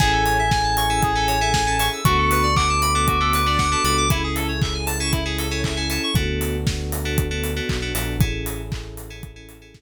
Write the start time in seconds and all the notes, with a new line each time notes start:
0.00 A1 C#4 E4 G#4 A4 G#5, kick, crash
0.13 A4
0.25 C#5, open hi-hat
0.39 E5
0.51 G#5, kick, snare
0.64 A5
0.77 C#6, open hi-hat
0.90 C#4 E4 G#4 A4 E6
1.03 G#4, kick, closed hi-hat
1.15 C#4 E4 G#4 A4
1.28 C#5, open hi-hat
1.41 C#4 E4 G#4 A4 E5
1.54 G#5, kick, snare
1.67 C#4 E4 G#4 A4 A5
1.79 C#4 E4 G#4 A4 C#6, open hi-hat
1.93 E6
2.05 D2 B3 D4 F#4 A4 C#6, kick, closed hi-hat
2.18 A4
2.31 B4, open hi-hat
2.43 D5
2.56 F#5 D6, kick, clap
2.69 A5
2.82 B5, open hi-hat
2.95 B3 D4 F#4 A4 D6
3.08 F#4, kick, closed hi-hat
3.21 B3 D4 F#4 A4
3.33 B4, open hi-hat
3.46 B3 D4 F#4 A4 D5
3.58 F#5, kick, snare
3.72 B3 D4 F#4 A4 A5
3.84 C#2 B3 D4 F#4 A4 B5, open hi-hat
3.98 D6
4.10 C#4 E4 G#4 A4, kick, closed hi-hat
4.24 G#4
4.35 A4, open hi-hat
4.48 C#5
4.62 E5, kick, clap
4.74 G#5
4.86 A5, open hi-hat
5.00 C#4 E4 G#4 A4 C#6
5.12 E4, kick, closed hi-hat
5.26 C#4 E4 G#4 A4
5.38 A4, open hi-hat
5.51 C#4 E4 G#4 A4 C#5
5.64 E5, kick, clap
5.77 C#4 E4 G#4 A4 G#5
5.90 C#4 E4 G#4 A4 A5, open hi-hat
6.03 C#6
6.14 D2 B3 D4 F#4 A4, kick, closed hi-hat
6.41 open hi-hat
6.67 kick, snare
6.92 open hi-hat
7.05 B3 D4 F#4 A4
7.18 kick, closed hi-hat
7.31 B3 D4 F#4 A4
7.44 open hi-hat
7.56 B3 D4 F#4 A4
7.69 B1, kick, clap
7.82 B3 D4 F#4 A4
7.95 A#1 B3 D4 F#4 A4, open hi-hat
8.19 A1 C#4 E4 G#4 A4, kick, closed hi-hat
8.46 open hi-hat
8.72 kick, clap
8.97 open hi-hat
9.10 C#4 E4 G#4 A4
9.23 kick, closed hi-hat
9.36 C#4 E4 G#4 A4
9.49 open hi-hat
9.62 C#4 E4 G#4 A4
9.74 kick, snare